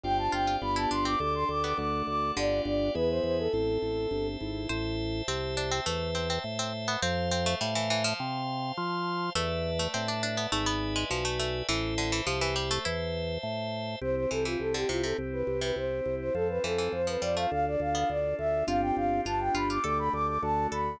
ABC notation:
X:1
M:4/4
L:1/16
Q:1/4=103
K:C
V:1 name="Flute"
g a g2 b a c' d' d' c' d' d' d'2 d'2 | d2 d2 B c c A7 z2 | [K:Am] z16 | z16 |
z16 | z16 | [K:C] c c A F A G F A z B2 B c3 c | A B A2 c B d f f d f f d2 e2 |
f g f2 a g b d' d' b d' d' a2 b2 |]
V:2 name="Harpsichord"
z2 F F2 E D C z3 B,3 z2 | D,4 z12 | [K:Am] c2 z2 C2 D C A,2 C C z C z B, | C2 C A, G, E, E, F,3 z6 |
A,3 A, C D D B, A, B,2 ^G, F, A, A,2 | E,2 D, E, F, E, G, A, E4 z4 | [K:C] z2 E, E,2 D, C, C, z3 C,3 z2 | z2 E, E,2 F, G, A, z3 B,3 z2 |
F4 F2 F F A6 A2 |]
V:3 name="Acoustic Grand Piano"
[CDFG]4 [B,DFG]4 [A,DG]4 [A,D^F]4 | [B,DFG]4 [B,E^G]4 C2 A2 C2 E2 | [K:Am] z16 | z16 |
z16 | z16 | [K:C] C2 G2 C2 E2 C2 G2 C2 E2 | C2 A2 C2 F2 D2 A2 D2 F2 |
[CDFG]4 [B,DFG]4 [A,DG]4 [A,D^F]4 |]
V:4 name="Drawbar Organ" clef=bass
G,,,2 G,,,2 G,,,2 G,,,2 D,,2 D,,2 D,,2 D,,2 | G,,,2 G,,,2 E,,2 E,,2 A,,,2 A,,,2 G,,,2 ^G,,,2 | [K:Am] A,,,4 C,,4 E,,4 A,,4 | F,,4 A,,4 C,4 F,4 |
E,,4 A,,4 ^G,,,4 B,,,4 | A,,,4 C,,4 E,,4 A,,4 | [K:C] C,,2 C,,2 C,,2 C,,2 C,,2 C,,2 C,,2 C,,2 | F,,2 F,,2 F,,2 F,,2 D,,2 D,,2 D,,2 D,,2 |
G,,,2 G,,,2 G,,,2 G,,,2 D,,2 D,,2 D,,2 D,,2 |]
V:5 name="Drawbar Organ"
[cdfg]4 [Bdfg]4 [Adg]4 [Ad^f]4 | [Bdfg]4 [Be^g]4 [cea]8 | [K:Am] [cea]16 | [cfa]16 |
[Bdea]8 [Bde^g]8 | [cea]16 | [K:C] [CEG]8 [CEG]8 | [CFA]8 [DFA]8 |
[CDFG]4 [B,DFG]4 [A,DG]4 [A,D^F]4 |]